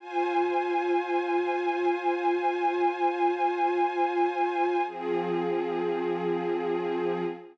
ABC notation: X:1
M:3/4
L:1/8
Q:1/4=74
K:Fdor
V:1 name="String Ensemble 1"
[Fca]6- | [Fca]6 | [F,CA]6 |]